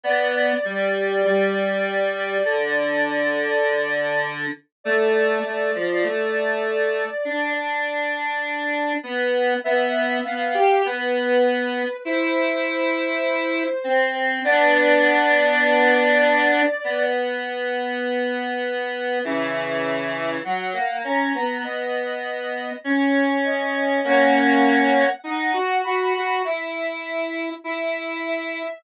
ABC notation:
X:1
M:4/4
L:1/16
Q:1/4=50
K:C
V:1 name="Ocarina"
d16 | d10 z6 | e2 f2 B4 c8 | d10 z6 |
[K:B] e4 f2 a2 d4 c2 d2 | f4 f2 b2 e4 e2 e2 |]
V:2 name="Lead 1 (square)"
B,2 G,2 G,4 D,8 | A,2 A, F, A,4 D6 B,2 | B,2 B, G B,4 E6 C2 | [B,D]8 B,8 |
[K:B] [C,E,]4 F, A, C B, B,4 C4 | [A,C]4 D F F F E4 E4 |]